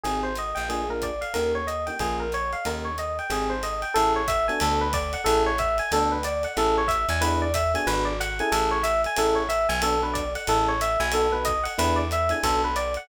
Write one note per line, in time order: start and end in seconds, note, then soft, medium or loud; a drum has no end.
0.04 0.54 G#1 medium
0.04 0.30 C4 medium
0.04 0.30 D#4 medium
0.04 0.30 G4 medium
0.04 0.22 G#4 medium
0.04 0.30 G#4 medium
0.04 ride medium
0.23 0.35 C5 medium
0.35 0.57 D#5 medium
0.35 hi-hat pedal medium
0.35 ride medium
0.55 1.25 A#1 loud
0.55 0.67 G5 medium
0.55 ride medium
0.69 0.83 A#3 medium
0.69 0.83 D4 medium
0.69 0.83 F4 medium
0.69 0.83 G#4 medium
0.69 0.88 G#4 medium
0.69 ride medium
0.89 1.10 A#3 medium
0.89 1.10 D4 medium
0.89 1.10 F4 medium
0.89 1.10 G#4 medium
0.89 1.02 A#4 medium
1.02 1.21 D5 medium
1.02 kick soft
1.02 hi-hat pedal medium
1.02 ride medium
1.21 1.33 F5 medium
1.21 ride medium
1.34 1.90 D#2 loud
1.34 1.60 A#3 medium
1.34 1.60 C#4 medium
1.34 1.60 D#4 medium
1.34 1.60 G4 medium
1.34 1.52 A#4 medium
1.34 ride medium
1.55 1.67 C#5 medium
1.67 1.85 D#5 medium
1.67 hi-hat pedal medium
1.67 ride medium
1.87 1.97 A#3 medium
1.87 1.97 C#4 medium
1.87 1.97 D#4 medium
1.87 1.97 G4 medium
1.87 1.99 G5 medium
1.87 ride medium
1.99 2.55 A#1 loud
1.99 2.25 A#3 medium
1.99 2.25 C#4 medium
1.99 2.25 F4 medium
1.99 2.18 G#4 medium
1.99 2.25 G#4 medium
1.99 kick soft
1.99 ride medium
2.20 2.32 A#4 medium
2.32 2.52 C#5 medium
2.32 hi-hat pedal medium
2.32 ride medium
2.53 2.65 F5 medium
2.53 ride medium
2.65 3.20 D#2 medium
2.65 2.90 A#3 medium
2.65 2.90 C#4 medium
2.65 2.90 D#4 medium
2.65 2.90 G4 medium
2.65 2.84 A#4 medium
2.65 ride medium
2.85 2.97 C#5 medium
2.98 3.17 D#5 medium
2.98 hi-hat pedal medium
2.98 ride medium
3.19 3.31 G5 medium
3.19 ride medium
3.30 3.85 G#1 loud
3.30 3.54 C4 medium
3.30 3.54 D#4 medium
3.30 3.54 G4 medium
3.30 3.54 G#4 medium
3.30 3.50 G#4 medium
3.30 ride medium
3.50 3.62 C5 medium
3.63 3.81 D#5 medium
3.63 hi-hat pedal medium
3.63 ride medium
3.82 3.94 G5 medium
3.82 ride medium
3.94 4.50 A1 loud
3.94 4.21 C#4 medium
3.94 4.21 E4 medium
3.94 4.21 G#4 medium
3.94 4.12 A4 loud
3.94 4.21 A4 medium
3.94 ride loud
4.16 4.28 C#5 medium
4.28 4.46 E5 medium
4.28 kick medium
4.28 hi-hat pedal medium
4.28 ride medium
4.48 4.87 B3 medium
4.48 4.87 D4 medium
4.48 4.87 F#4 medium
4.48 4.87 A4 medium
4.48 4.60 G#5 medium
4.48 ride medium
4.60 5.16 D2 loud
4.60 4.79 A4 medium
4.60 ride loud
4.81 4.93 B4 medium
4.93 5.12 D5 loud
4.93 kick medium
4.93 hi-hat pedal medium
4.93 ride loud
5.13 5.25 F#5 medium
5.13 ride medium
5.24 5.81 A1 loud
5.24 5.50 C#4 medium
5.24 5.50 E4 medium
5.24 5.50 G#4 loud
5.24 5.42 A4 medium
5.24 5.50 A4 medium
5.24 ride loud
5.46 5.58 C#5 medium
5.58 5.77 E5 medium
5.58 kick medium
5.58 hi-hat pedal medium
5.58 ride medium
5.78 5.91 G#5 medium
5.78 ride medium
5.92 6.46 D2 loud
5.92 6.17 B3 medium
5.92 6.17 D4 loud
5.92 6.17 F#4 medium
5.92 6.17 A4 medium
5.92 6.11 A4 medium
5.92 ride loud
6.12 6.24 B4 medium
6.23 6.43 D5 medium
6.23 hi-hat pedal medium
6.23 ride medium
6.43 6.56 F#5 medium
6.43 ride medium
6.57 7.06 A1 loud
6.57 6.82 C#4 loud
6.57 6.82 E4 medium
6.57 6.82 G#4 medium
6.57 6.82 A4 medium
6.57 6.76 A4 medium
6.57 ride medium
6.78 6.90 C#5 medium
6.88 7.06 E5 medium
6.88 kick medium
6.88 hi-hat pedal medium
6.88 ride medium
7.09 7.76 E2 loud
7.09 7.22 G#5 medium
7.09 ride medium
7.21 7.46 B3 loud
7.21 7.46 D4 medium
7.21 7.46 E4 loud
7.21 7.46 G#4 medium
7.21 7.39 B4 medium
7.21 ride loud
7.42 7.54 D5 medium
7.54 7.72 E5 medium
7.54 kick medium
7.54 hi-hat pedal medium
7.54 ride medium
7.74 8.12 B3 medium
7.74 8.12 D4 medium
7.74 8.12 F#4 medium
7.74 8.12 G#4 medium
7.74 7.87 G#5 medium
7.74 ride medium
7.87 8.42 G#1 loud
7.87 8.05 B4 medium
7.87 ride medium
8.05 8.17 D5 medium
8.20 8.38 F#5 medium
8.20 hi-hat pedal medium
8.20 ride medium
8.39 8.78 C#4 medium
8.39 8.78 E4 medium
8.39 8.78 G#4 loud
8.39 8.78 A4 medium
8.39 8.52 G#5 medium
8.39 ride medium
8.52 9.07 A1 loud
8.52 8.70 A4 medium
8.52 ride loud
8.71 8.83 C#5 medium
8.83 9.01 E5 medium
8.83 hi-hat pedal medium
8.83 ride medium
9.04 9.18 G#5 medium
9.04 ride medium
9.16 9.67 A1 loud
9.16 9.42 C#4 medium
9.16 9.42 E4 loud
9.16 9.42 G#4 medium
9.16 9.42 A4 medium
9.16 9.36 A4 medium
9.16 ride loud
9.35 9.47 C#5 medium
9.49 9.67 E5 medium
9.49 hi-hat pedal medium
9.49 ride medium
9.69 10.37 B1 loud
9.69 9.81 G#5 medium
9.69 ride medium
9.82 9.96 B3 loud
9.82 9.96 D4 medium
9.82 9.96 F#4 loud
9.82 9.96 A4 medium
9.82 10.00 A4 medium
9.82 ride loud
10.02 10.23 B3 medium
10.02 10.23 D4 medium
10.02 10.23 F#4 medium
10.02 10.23 A4 medium
10.02 10.15 B4 medium
10.14 10.32 D5 medium
10.14 kick medium
10.14 hi-hat pedal medium
10.14 ride medium
10.35 10.47 F#5 medium
10.35 ride medium
10.47 10.97 A1 loud
10.47 10.73 C#4 medium
10.47 10.73 E4 medium
10.47 10.73 G#4 medium
10.47 10.73 A4 loud
10.47 10.67 A4 medium
10.47 ride loud
10.68 10.80 C#5 medium
10.81 10.99 E5 medium
10.81 hi-hat pedal medium
10.81 ride medium
11.00 11.68 B1 loud
11.00 11.12 G#5 medium
11.00 ride medium
11.12 11.27 B3 medium
11.12 11.27 D#4 medium
11.12 11.27 F#4 medium
11.12 11.27 A4 medium
11.12 11.32 A4 medium
11.12 ride loud
11.32 11.54 B3 medium
11.32 11.54 D#4 medium
11.32 11.54 F#4 medium
11.32 11.54 A4 medium
11.32 11.44 B4 medium
11.45 11.63 D#5 medium
11.45 kick medium
11.45 hi-hat pedal medium
11.45 ride medium
11.63 11.75 F#5 medium
11.63 ride medium
11.78 12.33 E2 loud
11.78 12.03 B3 medium
11.78 12.03 D4 medium
11.78 12.03 E4 loud
11.78 12.03 G#4 medium
11.78 11.97 B4 loud
11.78 ride loud
11.96 12.08 D5 medium
12.11 12.31 E5 medium
12.11 hi-hat pedal medium
12.11 ride medium
12.29 12.39 B3 medium
12.29 12.39 D4 medium
12.29 12.39 E4 medium
12.29 12.39 G#4 medium
12.29 12.43 G#5 medium
12.29 ride medium
12.43 12.98 B1 loud
12.43 12.69 B3 medium
12.43 12.69 D4 medium
12.43 12.69 F#4 medium
12.43 12.62 A4 medium
12.43 12.69 A4 medium
12.43 kick medium
12.43 ride loud
12.64 12.76 B4 medium
12.76 12.94 D5 loud
12.76 hi-hat pedal medium
12.76 ride medium
12.94 13.08 F#5 medium
12.94 ride medium